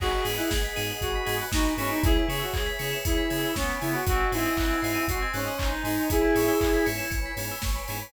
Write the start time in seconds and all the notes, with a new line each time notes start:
0.00 G#1 B3 D#4 F#4 G#4 B4 D#5 F#5 G#5, kick, crash
0.11 B5
0.24 G#2 B3 D#4 F#4 G#4 D#6, open hi-hat
0.38 E4 F#6
0.51 G#1 G#6, kick, snare
0.64 B6
0.76 G#2 B3 D#4 F#4 G#4 D#7, open hi-hat
0.90 F#7
1.01 G#1 F#4 B4 D#5 G#5 B5 D#7, kick, closed hi-hat
1.15 B6
1.26 G#2 B3 D#4 F#4 G#4 G#6, open hi-hat
1.41 F#6
1.52 G#1 D#4 F#4 D#6, kick, snare
1.66 B5
1.77 G#2 B3 C#4 E4 G#4 G#5, open hi-hat
1.89 D#4 B5
2.03 C#2 E4 G#4 B4 C#5 E5 G#5, kick, closed hi-hat
2.16 B5
2.28 C#3 B3 C#4 E4 G#4 C#6, open hi-hat
2.40 F#4 E6
2.54 C#2 G#6, kick, clap
2.66 B6
2.79 C#3 B3 C#4 E4 G#4 C#7, open hi-hat
2.92 E7
3.05 C#2 E4 B4 C#5 G#5 B5 C#7, kick, closed hi-hat
3.17 B6
3.30 C#3 B3 C#4 E4 G#4 G#6, open hi-hat
3.45 E6
3.56 C#2 B3 C#4 C#6, kick, snare
3.69 B5
3.81 C#3 B3 C#4 E4 G#4 G#5, open hi-hat
3.94 F#4 B5
4.06 G#1 C4 D#4 F#4 G#4 C5 D#5 F#5 G#5, kick, closed hi-hat
4.20 G#5
4.32 G#2 C4 D#4 E4 F#4 G#4 C6, open hi-hat
4.45 D#6
4.57 G#1 F#6, kick, clap
4.70 G#6
4.82 G#2 C4 D#4 F#4 G#4 C7, open hi-hat
4.95 D#7
5.07 G#1 F#4 C5 D#5 G#5 C6 C7, kick, closed hi-hat
5.22 G#6
5.33 G#2 C4 C#4 D#4 F#4 G#4 F#6, open hi-hat
5.47 D#6
5.58 G#1 D#4 C6, kick, clap
5.72 G#5
5.84 G#2 C4 D#4 F#4 G#4 G#5, open hi-hat
6.09 G#1 B3 C#4 E4 G#4 B4 C#5 E5 G#5, kick, closed hi-hat
6.21 B5
6.35 G#2 B3 C#4 E4 G#4 C#6, open hi-hat
6.48 E6
6.61 G#1 E4 G#6, kick, clap
6.74 B6
6.86 G#2 B3 C#4 E4 G#4 C#7, open hi-hat
6.98 E7
7.10 G#1 B4 C#5 G#5 B5 C#7, kick, closed hi-hat
7.26 B6
7.37 G#2 B3 C#4 E4 G#4 G#6, open hi-hat
7.51 E6
7.62 G#1 C#6, kick, snare
7.76 B5
7.88 G#2 B3 C#4 E4 G#4 G#5, open hi-hat
8.02 B5